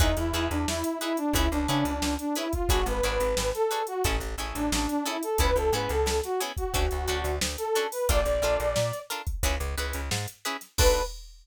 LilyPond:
<<
  \new Staff \with { instrumentName = "Brass Section" } { \time 4/4 \key b \dorian \tempo 4 = 89 dis'16 e'8 d'16 e'8 e'16 d'16 e'16 d'16 d'16 d'8 d'16 e'16 eis'16 | fis'16 b'4 a'8 fis'16 r8. d'16 d'16 d'16 e'16 a'16 | b'16 a'16 b'16 a'8 fis'16 r16 fis'4~ fis'16 r16 a'8 b'16 | d''4. r2 r8 |
b'4 r2. | }
  \new Staff \with { instrumentName = "Acoustic Guitar (steel)" } { \time 4/4 \key b \dorian <dis' e' gis' b'>8 <dis' e' gis' b'>4 <dis' e' gis' b'>8 <cis' e' gis' b'>8 <cis' e' gis' b'>4 <cis' e' gis' b'>8 | <d' fis' gis' b'>8 <d' fis' gis' b'>4 <d' fis' gis' b'>8 <cis' e' gis' a'>8 <cis' e' gis' a'>4 <cis' e' gis' a'>8 | <b cis' e' gis'>8 <b cis' e' gis'>4 <b cis' e' gis'>8 <cis' d' fis' a'>8 <cis' d' fis' a'>4 <cis' d' fis' a'>8 | <d' eis' a' ais'>8 <d' eis' a' ais'>4 <d' eis' a' ais'>8 <cis' e' gis' b'>8 <cis' e' gis' b'>4 <cis' e' gis' b'>8 |
<d' fis' a' b'>4 r2. | }
  \new Staff \with { instrumentName = "Electric Bass (finger)" } { \clef bass \time 4/4 \key b \dorian e,16 e,16 e,16 e,16 e,4 cis,16 cis,16 cis16 cis,16 cis,4 | gis,,16 gis,,16 gis,,16 gis,,16 gis,,4 a,,16 a,,16 a,,16 a,,16 a,,4 | cis,16 cis,16 gis,16 cis,16 cis,4 d,16 d,16 d,16 d,16 d,4 | ais,,16 ais,,16 ais,,16 ais,,16 ais,4 cis,16 cis,16 cis,16 cis,16 gis,4 |
b,,4 r2. | }
  \new DrumStaff \with { instrumentName = "Drums" } \drummode { \time 4/4 <hh bd>16 hh16 hh16 hh16 sn16 hh16 hh16 hh16 <hh bd>16 hh16 hh16 hh16 sn16 hh16 hh16 <hh bd>16 | <hh bd>16 <hh sn>16 hh16 hh16 sn16 <hh sn>16 hh16 hh16 <hh bd>16 hh16 hh16 hh16 sn16 hh16 hh16 hh16 | <hh bd>16 hh16 hh16 <hh sn>16 sn16 <hh sn>16 hh16 <hh bd>16 <hh bd>16 hh16 hh16 hh16 sn16 hh16 hh16 hho16 | <hh bd>16 hh16 hh16 hh16 sn16 <hh sn>16 hh16 <hh bd>16 <hh bd>16 hh16 hh16 <hh sn>16 sn16 hh16 hh16 <hh sn>16 |
<cymc bd>4 r4 r4 r4 | }
>>